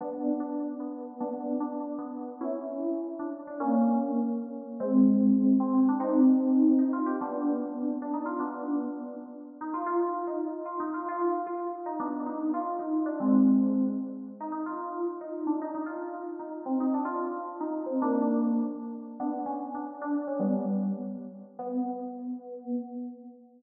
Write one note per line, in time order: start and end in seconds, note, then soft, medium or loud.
0.01 0.35 B3 medium
0.01 0.35 D4 medium
0.40 0.74 D4 medium
0.80 1.14 B3 medium
1.20 1.53 B3 medium
1.20 1.53 D4 medium
1.60 1.99 D4 medium
1.98 2.34 B3 medium
2.41 3.07 C#4 medium
2.41 3.07 E4 medium
3.19 3.32 D4 medium
3.47 3.60 D4 medium
3.60 4.20 A#3 medium
3.60 4.20 C#4 medium
4.80 5.53 G#3 medium
4.80 5.53 C4 medium
5.60 5.73 C4 medium
5.74 5.86 C4 medium
5.89 5.99 D4 medium
6.00 6.73 C4 medium
6.00 6.73 D#4 loud
6.79 6.91 D#4 medium
6.93 7.06 F4 medium
7.06 7.19 G4 medium
7.21 7.87 B3 medium
7.21 7.87 D4 medium
8.02 8.14 D4 medium
8.13 8.26 D#4 medium
8.26 8.37 F4 medium
8.39 9.04 B3 medium
8.39 9.04 D4 medium
9.61 9.73 D#4 medium
9.74 9.86 F4 medium
9.86 10.21 F4 medium
10.27 10.38 D#4 medium
10.65 10.77 F4 medium
10.80 10.91 D#4 medium
10.94 11.05 F4 medium
11.08 11.42 F4 medium
11.46 11.58 F4 medium
11.86 11.99 D#4 medium
12.00 12.25 B3 medium
12.00 12.25 D4 medium
12.26 12.49 D#4 medium
12.54 12.77 F4 medium
12.79 13.03 D#4 medium
13.06 13.17 D4 medium
13.20 13.72 G#3 medium
13.20 13.72 C4 medium
14.40 14.51 D#4 medium
14.52 14.63 D#4 medium
14.66 15.03 F4 medium
15.21 15.47 D#4 medium
15.47 15.58 D4 medium
15.62 15.74 D#4 medium
15.74 15.86 D#4 medium
15.86 16.20 F4 medium
16.39 16.61 D#4 medium
16.66 16.79 C4 medium
16.80 16.91 D#4 medium
16.94 17.05 D4 medium
17.05 17.44 F4 medium
17.60 17.84 D#4 medium
17.86 17.97 C4 medium
18.02 18.50 A#3 medium
18.02 18.50 D4 loud
19.20 19.42 B3 medium
19.20 19.42 D4 medium
19.46 19.70 C#4 medium
19.74 20.01 D4 medium
20.01 20.23 D4 medium
20.27 20.40 C#4 medium
20.39 20.91 G3 medium
20.39 20.91 B3 medium
21.59 22.72 B3 loud